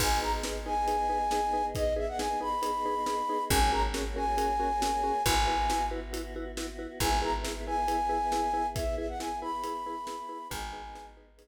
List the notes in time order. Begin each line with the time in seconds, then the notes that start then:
0.00 G#1 B3 D#4 G#4 B4 G#5, kick, crash
0.22 D#4 G#4 B4 A#5
0.43 D#4 G#4 B4, snare
0.66 D#4 G#4 B4 G#5
0.88 D#4 G#4 B4, closed hi-hat
1.09 D#4 G#4 B4
1.31 D#4 G#4 B4, snare
1.53 D#4 G#4 B4
1.75 D#4 G#4 B4 D#5, kick, closed hi-hat
1.96 D#4 G#4 B4 E5
2.08 F#5
2.19 D#4 G#4 B4 G#5, snare
2.41 D#4 G#4 B4 B5
2.62 D#4 G#4 B4, closed hi-hat
2.86 D#4 G#4 B4
3.06 D#4 G#4 B4, snare
3.29 D#4 G#4 B4
3.50 G#1 A#3 C#4 F#4 G#4 A#4 G#5, kick, closed hi-hat
3.72 C#4 F#4 G#4 A#4 A#5
3.94 C#4 F#4 G#4 A#4, snare
4.16 C#4 F#4 G#4 A#4 G#5
4.37 C#4 F#4 G#4 A#4, closed hi-hat
4.60 C#4 F#4 G#4 A#4
4.82 C#4 F#4 G#4 A#4, snare
5.03 C#4 F#4 G#4 A#4
5.25 G#1 B3 E4 F#4 B4 G#5, kick, closed hi-hat
5.47 E4 F#4 B4
5.70 E4 F#4 B4, snare
5.91 E4 F#4 B4
6.13 E4 F#4 B4, closed hi-hat
6.36 E4 F#4 B4
6.57 E4 F#4 B4, snare
6.79 E4 F#4 B4
7.00 G#1 B3 E4 G#4 B4 G#5, kick, closed hi-hat
7.22 E4 G#4 B4 A#5
7.44 E4 G#4 B4, snare
7.66 E4 G#4 B4 G#5
7.88 E4 G#4 B4, closed hi-hat
8.09 E4 G#4 B4
8.32 E4 G#4 B4, snare
8.54 E4 G#4 B4
8.76 E4 G#4 B4 E5, kick, closed hi-hat
8.98 E4 G#4 B4 E5
9.09 F#5
9.20 E4 G#4 B4 G#5, snare
9.42 E4 G#4 B4 B5
9.64 E4 G#4 B4, closed hi-hat
9.86 E4 G#4 B4
10.07 E4 G#4 B4, snare
10.29 E4 G#4 B4
10.50 G#1 B3 D#4 G#4 B4 G#5, kick, closed hi-hat
10.73 D#4 G#4 B4
10.95 D#4 G#4 B4, snare
11.17 D#4 G#4 B4
11.38 D#4 G#4 B4, closed hi-hat